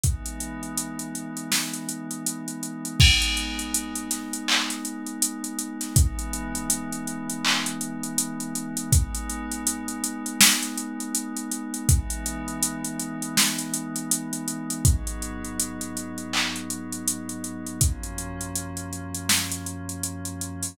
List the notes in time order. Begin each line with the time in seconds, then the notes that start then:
0.03 E3 G#3 B3 D#4, kick, closed hi-hat
0.26 closed hi-hat
0.40 closed hi-hat
0.63 closed hi-hat
0.77 closed hi-hat
0.99 closed hi-hat
1.15 closed hi-hat
1.37 closed hi-hat
1.52 snare
1.73 closed hi-hat
1.89 closed hi-hat
2.11 closed hi-hat
2.26 closed hi-hat
2.48 closed hi-hat
2.63 closed hi-hat
2.85 closed hi-hat
3.00 G#3 B3 D#4, kick, crash
3.22 closed hi-hat
3.37 closed hi-hat
3.59 closed hi-hat
3.74 closed hi-hat
3.95 closed hi-hat
4.11 snare, closed hi-hat
4.33 closed hi-hat
4.48 clap
4.70 snare, closed hi-hat
4.85 closed hi-hat
5.06 closed hi-hat
5.22 closed hi-hat
5.44 closed hi-hat
5.58 closed hi-hat
5.81 snare, closed hi-hat
5.96 E3 G#3 B3 D#4, kick, closed hi-hat
6.19 closed hi-hat
6.33 closed hi-hat
6.55 closed hi-hat
6.70 closed hi-hat
6.92 closed hi-hat
7.07 closed hi-hat
7.29 closed hi-hat
7.45 clap
7.66 closed hi-hat
7.81 closed hi-hat
8.03 closed hi-hat
8.18 closed hi-hat
8.40 closed hi-hat
8.55 closed hi-hat
8.77 closed hi-hat
8.92 G#3 B3 D#4, kick, closed hi-hat
9.15 closed hi-hat
9.29 closed hi-hat
9.51 closed hi-hat
9.67 closed hi-hat
9.88 closed hi-hat
10.04 closed hi-hat
10.26 closed hi-hat
10.41 snare
10.63 closed hi-hat
10.77 closed hi-hat
11.00 closed hi-hat
11.15 closed hi-hat
11.36 closed hi-hat
11.51 closed hi-hat
11.74 closed hi-hat
11.89 E3 G#3 B3 D#4, kick, closed hi-hat
12.10 closed hi-hat
12.26 closed hi-hat
12.48 closed hi-hat
12.63 closed hi-hat
12.84 closed hi-hat
12.99 closed hi-hat
13.22 closed hi-hat
13.37 snare
13.58 closed hi-hat
13.74 closed hi-hat
13.96 closed hi-hat
14.11 closed hi-hat
14.33 closed hi-hat
14.48 closed hi-hat
14.70 closed hi-hat
14.85 G#2 F#3 B3 D#4, kick, closed hi-hat
15.07 closed hi-hat
15.22 closed hi-hat
15.44 closed hi-hat
15.59 closed hi-hat
15.81 closed hi-hat
15.97 closed hi-hat
16.18 closed hi-hat
16.33 clap
16.56 closed hi-hat
16.70 closed hi-hat
16.92 closed hi-hat
17.08 closed hi-hat
17.29 closed hi-hat
17.44 closed hi-hat
17.67 closed hi-hat
17.81 F#2 F3 A#3 C#4, kick, closed hi-hat
18.03 closed hi-hat
18.18 closed hi-hat
18.41 closed hi-hat
18.55 closed hi-hat
18.77 closed hi-hat
18.93 closed hi-hat
19.15 closed hi-hat
19.29 snare
19.52 closed hi-hat
19.66 closed hi-hat
19.89 closed hi-hat
20.03 closed hi-hat
20.25 closed hi-hat
20.41 closed hi-hat
20.63 open hi-hat